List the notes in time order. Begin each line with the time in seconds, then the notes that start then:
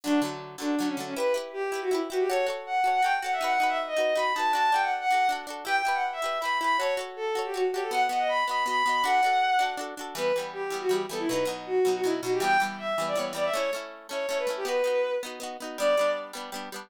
0.04 D3 F#3 A3 D4
0.22 D3 F#3 A3
0.58 D3 F#3 A3 D4
0.78 D3 F#3 A3 D4
0.88 C#4
0.97 D3 F#3 A3
1.06 C#4
1.16 E4 G4 B4
1.20 B4
1.34 E4 G4 B4
1.53 G4
1.72 E4 G4 B4
1.81 F#4
1.91 E4 G4 B4
2.10 E4 F#4 G4 B4
2.19 G4
2.29 F#4 A4 C#5
2.47 F#4 A4 C#5
2.66 F#5
2.84 F#4 A4 C#5
2.93 F#5
3.03 F#4 A4 C#5 G5
3.22 F#4 A4 C#5 F#5
3.33 E5
3.41 D#4 F#4 B4 F#5
3.51 F#5
3.60 D#4 F#4 B4
3.69 E5
3.87 D#5
3.97 D#4 F#4 B4
4.15 D#4 F#4 B4 B5
4.34 D#4 F#4 A5
4.39 B4
4.53 D4 F#4 A4 A5
4.63 A5
4.72 D4 F#4 A4 G5
4.82 F#5
5.00 F#5
5.11 D4 F#4 A4
5.29 D4 F#4 A4
5.47 D4 F#4 A4
5.65 E4 G4 B4 G5
5.75 G5
5.85 E4 G4 B4
5.94 F#5
6.12 E5
6.22 E4 G4 B4
6.40 E4 G4 B5
6.45 B4
6.60 E4 G4 B5
6.64 B4
6.78 F#4 A4 C#5
6.83 C#5
6.97 F#4 A4 C#5
7.16 A4
7.35 F#4 A4 C#5
7.45 G4
7.54 F#4 A4 C#5
7.73 F#4 G4 A4
7.77 C#5
7.82 A4
7.91 B3 F#4 D#5 F#5
8.09 B3 F#4 D#5 F#5
8.19 D#5
8.28 B5
8.47 B3 F#4 D#5 B5
8.66 B3 F#4 D#5 B5
8.86 B3 F#4 D#5
9.04 D4 F#4 A4 F#5
9.23 D4 F#4 A4
9.59 D4 F#4 A4
9.77 D4 F#4 A4
9.97 D4 F#4 A4
10.15 E3 G3 B3 B4
10.36 E3 G3 B3
10.53 G4
10.70 E3 G3 B3
10.81 F#4
10.89 E3 G3 B3 G4
11.09 E3 G3 B3 A4
11.19 E4
11.28 B2 F#3 B4
11.33 D#4
11.45 B2 F#3 D#4
11.66 F#4
11.85 B2 F#3 D#4
11.95 F#4
12.04 B2 F#3 D#4 E4
12.22 B2 F#3 D#4 F#4
12.33 G4
12.40 E3 G3 B3 G5
12.60 E3 G3 B3
12.79 E5
12.98 E3 G3 B3
13.07 D5
13.15 E3 G3 B3 C#5
13.33 E3 G3 B3 D5
13.44 E5
13.53 A3 C#4 E4 C#5
13.73 A3 C#4 E4
14.09 A3 C#4 E4 C#5
14.29 A3 C#4 E4 C#5
14.38 B4
14.47 A3 C#4 E4
14.57 G4
14.65 B3 D#4 F#4 B4
14.84 B3 D#4 F#4
15.23 B3 D#4 F#4
15.40 B3 D#4 F#4
15.60 B3 D#4 F#4
15.78 G3 B3 D4 D5
15.97 G3 B3 D4
16.33 G3 B3 D4
16.52 G3 B3 D4
16.72 G3 B3 D4